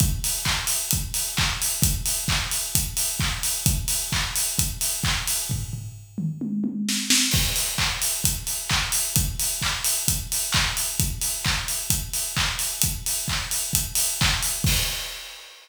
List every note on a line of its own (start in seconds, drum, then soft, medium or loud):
0.00 kick loud
0.00 closed hi-hat loud
0.24 open hi-hat medium
0.45 kick medium
0.45 clap loud
0.67 open hi-hat medium
0.91 kick medium
0.91 closed hi-hat loud
1.14 open hi-hat medium
1.37 kick medium
1.37 clap loud
1.62 open hi-hat medium
1.82 kick loud
1.82 closed hi-hat loud
2.06 open hi-hat medium
2.28 kick medium
2.28 clap loud
2.51 open hi-hat medium
2.75 kick medium
2.75 closed hi-hat loud
2.97 open hi-hat medium
3.20 kick medium
3.20 clap loud
3.43 open hi-hat medium
3.66 kick loud
3.66 closed hi-hat loud
3.88 open hi-hat medium
4.12 kick medium
4.12 clap loud
4.36 open hi-hat medium
4.59 kick medium
4.59 closed hi-hat loud
4.81 open hi-hat medium
5.04 kick medium
5.04 clap loud
5.27 open hi-hat medium
5.50 kick medium
5.50 floor tom medium
5.73 floor tom medium
6.18 mid tom medium
6.41 high tom medium
6.64 high tom medium
6.89 snare medium
7.10 snare loud
7.31 kick loud
7.31 crash loud
7.56 open hi-hat medium
7.78 kick medium
7.78 clap loud
8.02 open hi-hat medium
8.24 kick medium
8.24 closed hi-hat loud
8.47 open hi-hat medium
8.69 kick medium
8.69 clap loud
8.92 open hi-hat medium
9.16 kick loud
9.16 closed hi-hat loud
9.40 open hi-hat medium
9.62 kick medium
9.62 clap loud
9.84 open hi-hat medium
10.08 kick medium
10.08 closed hi-hat loud
10.32 open hi-hat medium
10.52 kick medium
10.52 clap loud
10.77 open hi-hat medium
11.00 kick loud
11.00 closed hi-hat loud
11.21 open hi-hat medium
11.45 kick medium
11.45 clap loud
11.68 open hi-hat medium
11.90 kick medium
11.90 closed hi-hat loud
12.13 open hi-hat medium
12.37 kick medium
12.37 clap loud
12.59 open hi-hat medium
12.82 kick medium
12.82 closed hi-hat loud
13.06 open hi-hat medium
13.28 kick medium
13.28 clap loud
13.51 open hi-hat medium
13.73 kick medium
13.73 closed hi-hat loud
13.95 open hi-hat medium
14.21 kick loud
14.21 clap loud
14.43 open hi-hat medium
14.64 kick loud
14.64 crash loud